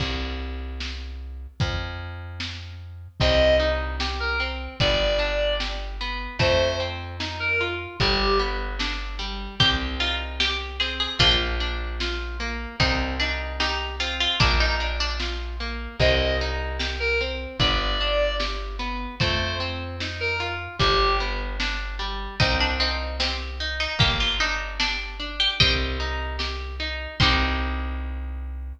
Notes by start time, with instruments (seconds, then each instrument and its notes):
0.00 electric bass (finger) C2, kick, crash
0.80 snare
1.60 electric bass (finger) F2, kick, closed hi-hat
2.40 snare
3.20 electric bass (finger) C2, orchestral harp C4, clarinet D#5, kick, crash
3.60 orchestral harp D#4
4.00 orchestral harp G4, snare
4.20 clarinet A#4
4.40 orchestral harp C4
4.80 electric bass (finger) G1, orchestral harp B3, clarinet D5, kick, ride
5.19 orchestral harp D4
5.60 orchestral harp G4, snare
6.01 orchestral harp B3
6.39 electric bass (finger) F2, orchestral harp A3, clarinet C5, kick, ride
6.80 orchestral harp C4
7.20 orchestral harp D#4, snare
7.40 clarinet A#4
7.61 orchestral harp F4
8.00 electric bass (finger) G1, orchestral harp G3, clarinet G4, kick, ride
8.39 orchestral harp B3
8.79 orchestral harp D4, snare
9.19 orchestral harp G3
9.60 electric bass (finger) C2, orchestral harp C4, pizzicato strings G4, kick, closed hi-hat
10.00 orchestral harp D#4, pizzicato strings F4
10.40 pizzicato strings G4, orchestral harp G4, snare
10.80 orchestral harp C4, pizzicato strings G#4
11.00 pizzicato strings G#4
11.19 electric bass (finger) A#1, orchestral harp A#3, pizzicato strings D4 F4, kick, closed hi-hat
11.60 orchestral harp D4
12.00 orchestral harp F4, snare
12.40 orchestral harp A#3
12.80 electric bass (finger) C2, orchestral harp C4, pizzicato strings D#4, kick, closed hi-hat
13.20 pizzicato strings D4, orchestral harp D#4
13.60 pizzicato strings D#4, orchestral harp G4, snare
14.00 orchestral harp C4, pizzicato strings F4
14.20 pizzicato strings F4
14.40 electric bass (finger) A#1, orchestral harp A#3, pizzicato strings D4, kick, closed hi-hat
14.60 pizzicato strings D#4
14.80 orchestral harp D4
15.00 pizzicato strings D4
15.20 orchestral harp F4, snare
15.60 orchestral harp A#3
16.00 electric bass (finger) C2, orchestral harp C4, clarinet D#5, kick, crash
16.41 orchestral harp D#4
16.80 orchestral harp G4, snare
17.00 clarinet A#4
17.21 orchestral harp C4
17.60 electric bass (finger) G1, orchestral harp B3, clarinet D5, kick, ride
18.01 orchestral harp D4
18.39 orchestral harp G4, snare
18.79 orchestral harp B3
19.20 electric bass (finger) F2, orchestral harp A3, clarinet C5, kick, ride
19.60 orchestral harp C4
20.00 orchestral harp D#4, snare
20.20 clarinet A#4
20.40 orchestral harp F4
20.79 electric bass (finger) G1, orchestral harp G3, clarinet G4, kick, ride
21.20 orchestral harp B3
21.60 orchestral harp D4, snare
21.99 orchestral harp G3
22.40 electric bass (finger) C2, orchestral harp C4, pizzicato strings D#4, kick, closed hi-hat
22.60 pizzicato strings D4
22.80 pizzicato strings C4, orchestral harp D#4
23.20 pizzicato strings C4, orchestral harp G4, snare
23.60 orchestral harp D#4
23.80 pizzicato strings D#4
23.99 electric bass (finger) G1, orchestral harp A#3, pizzicato strings G4, kick, closed hi-hat
24.20 pizzicato strings F4
24.40 orchestral harp D4, pizzicato strings D#4
24.80 pizzicato strings D4, orchestral harp G4, snare
25.20 orchestral harp D4
25.40 pizzicato strings G4
25.60 electric bass (finger) C2, orchestral harp C4, pizzicato strings D#5 G5, kick, closed hi-hat
26.00 orchestral harp D#4
26.39 orchestral harp G4, snare
26.80 orchestral harp D#4
27.20 electric bass (finger) C2, orchestral harp C4 D#4 G4, pizzicato strings C6, kick, crash